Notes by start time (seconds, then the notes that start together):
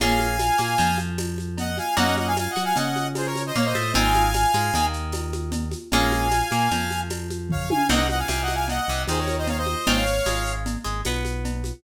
0.00 A#1 A#3 C#4 F4 G#4 F5 G#5, cowbell, low conga, shaker
0.19 high conga, shaker
0.39 tambourine, cowbell, high conga, shaker
0.58 A#2 A#3, high conga, shaker
0.78 F2 F3, cowbell, low conga, shaker
0.98 high conga, shaker
1.18 tambourine, cowbell, high conga, shaker
1.38 high conga, shaker
1.57 D#5 F#5, cowbell, low conga, shaker
1.78 F5 G#5, high conga, shaker
1.97 F#2 A#3 C#4 D#4 F#4 D#5 F#5, cowbell, low conga, shaker
2.16 D#5 F#5, high conga, shaker
2.27 F5 G#5
2.37 F5 G#5, tambourine, cowbell, high conga, shaker
2.50 D#5 F#5
2.56 F#3 F#4, high conga, shaker
2.64 F5 G#5
2.76 C#3 C#4 D#5 F#5, cowbell, low conga, shaker
2.96 high conga, shaker
3.15 G#4 C5, tambourine, cowbell, high conga, shaker
3.26 A#4 C#5
3.36 high conga, shaker
3.46 C5 D#5
3.55 A#2 A#3 C#5 F5, cowbell, low conga, shaker
3.65 C5 D#5
3.75 A2 A3, high conga, shaker
3.94 G#1 G#3 C4 D#4 F4 F5 G#5, cowbell, low conga, shaker
4.14 high conga, shaker
4.34 tambourine, cowbell, high conga, shaker
4.53 G#2 G#3, high conga, shaker
4.74 D#2 D#3, cowbell, low conga, shaker
4.93 shaker
5.12 tambourine, cowbell, high conga, shaker
5.33 high conga, shaker
5.52 cowbell, low conga, shaker
5.71 high conga, shaker
5.91 A#1 G#3 A#3 C#4 F4 F5 G#5, cowbell, low conga, shaker
6.11 high conga, shaker
6.31 tambourine, cowbell, high conga, shaker
6.51 A#2 A#3, high conga, shaker
6.70 F2 F3, cowbell, low conga, shaker
6.91 high conga, shaker
7.10 tambourine, cowbell, high conga, shaker
7.30 high conga, shaker
7.49 C#5 F5, kick, floor tom
7.70 F5 G#5, high tom
7.89 C2 A#3 C4 D#4 F#4 D#5 F#5, crash, cowbell, low conga, shaker
8.09 D#5 F#5, high conga, shaker
8.19 F5 G#5
8.28 C2 C3 F5 G#5, tambourine, cowbell, high conga, shaker
8.42 D#5 F#5
8.48 high conga, shaker
8.54 F5 G#5
8.68 D#5 F#5, cowbell, low conga, shaker
8.88 C2 C3, shaker
9.07 D#2 D#3 G#4 C5, tambourine, cowbell, high conga, shaker
9.18 A#4 C#5
9.28 high conga, shaker
9.38 C5 D#5
9.47 C#5 F5, cowbell, low conga, shaker
9.57 C5 D#5
9.66 high conga, shaker
9.86 G#1 G#3 C4 D#4 F4 C#5 F5, cowbell, low conga, shaker
10.06 shaker
10.26 G#1 G#3, tambourine, cowbell, high conga, shaker
10.46 shaker
10.66 cowbell, low conga, shaker
10.84 G#1 G#3, shaker
11.05 B1 B3, tambourine, cowbell, high conga, shaker
11.25 high conga, shaker
11.45 cowbell, low conga, shaker
11.64 high conga, shaker